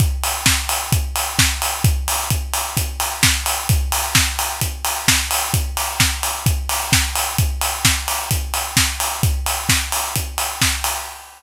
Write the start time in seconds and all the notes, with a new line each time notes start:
0.00 kick, closed hi-hat
0.24 open hi-hat
0.46 kick, snare
0.69 open hi-hat
0.92 kick, closed hi-hat
1.16 open hi-hat
1.39 kick, snare
1.62 open hi-hat
1.84 kick, closed hi-hat
2.08 open hi-hat
2.30 kick, closed hi-hat
2.54 open hi-hat
2.77 kick, closed hi-hat
3.00 open hi-hat
3.23 kick, snare
3.46 open hi-hat
3.69 kick, closed hi-hat
3.92 open hi-hat
4.15 kick, snare
4.39 open hi-hat
4.61 kick, closed hi-hat
4.85 open hi-hat
5.08 kick, snare
5.31 open hi-hat
5.54 kick, closed hi-hat
5.77 open hi-hat
6.00 kick, snare
6.23 open hi-hat
6.46 kick, closed hi-hat
6.69 open hi-hat
6.92 kick, snare
7.15 open hi-hat
7.38 kick, closed hi-hat
7.61 open hi-hat
7.85 kick, snare
8.08 open hi-hat
8.31 kick, closed hi-hat
8.54 open hi-hat
8.77 kick, snare
9.00 open hi-hat
9.23 kick, closed hi-hat
9.46 open hi-hat
9.69 kick, snare
9.92 open hi-hat
10.16 kick, closed hi-hat
10.38 open hi-hat
10.61 kick, snare
10.84 open hi-hat